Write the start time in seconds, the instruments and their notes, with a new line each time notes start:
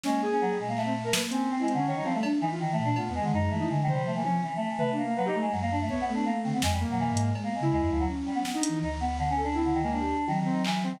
0.04 choir aahs G#3, flute A#3, ocarina C#4, snare
0.22 ocarina G#4
0.32 choir aahs C#4
0.41 choir aahs F#3
0.50 choir aahs G3
0.59 flute A#2, choir aahs G#3
0.68 choir aahs A#3
0.77 choir aahs A3, clap
0.85 ocarina C4
1.04 choir aahs A3, ocarina A#4
1.13 flute A#3, ocarina B4, snare
1.30 ocarina C4, choir aahs C#4, closed hi-hat
1.49 flute C4, choir aahs C4
1.59 choir aahs G#3, ocarina E4
1.68 ocarina C4, closed hi-hat
1.74 choir aahs D3, flute C#4, ocarina C#4
1.86 choir aahs D#3, ocarina C#5
1.96 flute G3, choir aahs D#4
2.05 choir aahs F3, ocarina C4, high tom
2.14 choir aahs A3, ocarina A3
2.23 flute D4, cowbell
2.41 choir aahs E3, flute E3, ocarina D#4, cowbell
2.51 ocarina F4
2.60 choir aahs D#3
2.72 choir aahs A3
2.79 flute A#2
2.84 choir aahs D4
2.96 flute A3, choir aahs B3, ocarina F4, cowbell
3.08 flute E2, ocarina B3
3.14 choir aahs G#3
3.21 choir aahs D3, flute D#3, ocarina G#3
3.33 flute F#2, ocarina G#3, choir aahs D#4
3.50 flute E3, choir aahs A3
3.59 ocarina D#4, flute E4
3.69 flute D3, choir aahs G#3
3.83 choir aahs D#3
3.88 ocarina C5, floor tom
3.92 choir aahs G3
3.98 flute F3
4.06 choir aahs A3
4.15 choir aahs E3, ocarina A#3
4.24 flute F3, ocarina C#4, choir aahs C#4, high tom
4.42 choir aahs E3
4.56 choir aahs A3
4.68 choir aahs E3
4.79 choir aahs A3, ocarina B4, floor tom
4.91 ocarina D4
4.97 choir aahs A#3
5.03 ocarina A#3
5.08 choir aahs A#3
5.16 choir aahs F#3, ocarina B4
5.25 choir aahs D#4, ocarina G4
5.34 ocarina A3
5.41 choir aahs G#3
5.51 flute F#2, choir aahs F#3
5.62 choir aahs A#3
5.71 choir aahs D4
5.81 choir aahs A3
5.89 choir aahs A3, flute B3, ocarina C#5, kick
6.01 choir aahs B3
6.07 ocarina A3
6.14 flute B3, choir aahs D4
6.26 choir aahs A#3
6.44 flute D3, choir aahs C4
6.53 choir aahs B3, flute C4
6.62 flute F2, choir aahs G#3, snare
6.72 choir aahs G3
6.80 ocarina A#3
6.87 flute B2, choir aahs F#3
7.00 choir aahs E3
7.10 flute G#2, choir aahs G#3
7.17 closed hi-hat
7.22 choir aahs G#3
7.35 flute G#3, cowbell
7.44 choir aahs A#3, flute B3
7.54 choir aahs G#3
7.60 flute C#3, ocarina E4
7.72 flute D#2, choir aahs G#3, cowbell
7.81 flute F2, choir aahs G#3
7.90 flute D2, choir aahs F3
7.99 choir aahs F#3
8.08 flute C#4
8.26 choir aahs G3
8.35 choir aahs B3
8.44 choir aahs B3, flute B3, snare
8.54 flute D4, ocarina D#4
8.63 closed hi-hat
8.69 flute E3
8.82 flute D2, choir aahs D#4
9.00 choir aahs B3
9.18 choir aahs D3
9.30 choir aahs C#4
9.37 ocarina A4
9.43 choir aahs D4
9.54 choir aahs C4, ocarina E4
9.64 choir aahs D3
9.74 choir aahs D#3
9.83 choir aahs G#3, ocarina A#3
9.92 choir aahs D4
9.99 ocarina G4
10.27 choir aahs D#3, flute F#3, high tom
10.39 choir aahs D#3
10.45 ocarina C4
10.51 choir aahs D#4
10.64 choir aahs E3, clap
10.83 choir aahs C4, ocarina C4
10.92 choir aahs D#3